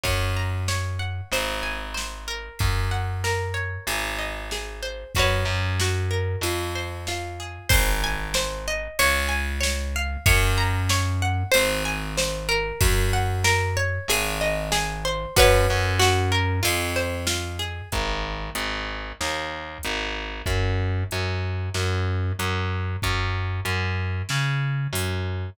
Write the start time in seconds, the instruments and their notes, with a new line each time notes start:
0.03 electric bass (finger) F#2, acoustic guitar (steel) C#5, kick, ride
0.37 acoustic guitar (steel) A#5
0.68 acoustic guitar (steel) C#5, snare
0.99 acoustic guitar (steel) F#5
1.32 electric bass (finger) G#1, acoustic guitar (steel) C5, ride
1.63 acoustic guitar (steel) G#5
1.94 acoustic guitar (steel) C5, snare
2.28 acoustic guitar (steel) A#4
2.59 electric bass (finger) F#2, kick, ride
2.91 acoustic guitar (steel) F#5
3.24 acoustic guitar (steel) A#4, snare
3.54 acoustic guitar (steel) C#5
3.87 electric bass (finger) G#1, acoustic guitar (steel) G#4, ride
4.18 acoustic guitar (steel) D#5
4.51 acoustic guitar (steel) G#4, snare
4.82 acoustic guitar (steel) C5
5.15 electric bass (finger) F#2, acoustic guitar (steel) F#4 B4, kick, ride
5.19 acoustic guitar (steel) C#5
5.45 electric bass (finger) F#2
5.80 acoustic guitar (steel) F#4, snare
6.11 acoustic guitar (steel) A#4
6.41 electric bass (finger) F2, acoustic guitar (steel) F4, ride
6.75 acoustic guitar (steel) C5
7.07 acoustic guitar (steel) F4, snare
7.40 acoustic guitar (steel) G#4
7.69 electric bass (finger) G#1, acoustic guitar (steel) C5, kick, crash
8.04 acoustic guitar (steel) G#5
8.34 acoustic guitar (steel) C5, snare
8.68 acoustic guitar (steel) D#5
8.99 electric bass (finger) C#2, acoustic guitar (steel) C#5, ride
9.29 acoustic guitar (steel) G#5
9.61 acoustic guitar (steel) C#5, snare
9.96 acoustic guitar (steel) F5
10.26 electric bass (finger) F#2, acoustic guitar (steel) C#5, kick, ride
10.58 acoustic guitar (steel) A#5
10.89 acoustic guitar (steel) C#5, snare
11.22 acoustic guitar (steel) F#5
11.51 electric bass (finger) G#1, acoustic guitar (steel) C5, ride
11.85 acoustic guitar (steel) G#5
12.17 acoustic guitar (steel) C5, snare
12.49 acoustic guitar (steel) A#4
12.81 electric bass (finger) F#2, kick, ride
13.13 acoustic guitar (steel) F#5
13.44 acoustic guitar (steel) A#4, snare
13.77 acoustic guitar (steel) C#5
14.08 electric bass (finger) G#1, acoustic guitar (steel) G#4, ride
14.41 acoustic guitar (steel) D#5
14.72 acoustic guitar (steel) G#4, snare
15.05 acoustic guitar (steel) C5
15.36 electric bass (finger) F#2, acoustic guitar (steel) F#4 B4 C#5, kick, ride
15.70 electric bass (finger) F#2
15.99 acoustic guitar (steel) F#4, snare
16.32 acoustic guitar (steel) A#4
16.63 electric bass (finger) F2, acoustic guitar (steel) F4, ride
16.96 acoustic guitar (steel) C5
17.27 acoustic guitar (steel) F4, snare
17.59 acoustic guitar (steel) G#4
17.92 electric bass (finger) G#1, kick, closed hi-hat
18.55 electric bass (finger) G#1, closed hi-hat
19.20 electric bass (finger) D#2, snare
19.83 electric bass (finger) G#1, closed hi-hat
20.46 electric bass (finger) F#2, kick, closed hi-hat
21.11 electric bass (finger) F#2, closed hi-hat
21.74 electric bass (finger) F#2, snare
22.39 electric bass (finger) F#2, closed hi-hat
23.02 electric bass (finger) F#2, kick, closed hi-hat
23.65 electric bass (finger) F#2, closed hi-hat
24.29 electric bass (finger) C#3, snare
24.93 electric bass (finger) F#2, open hi-hat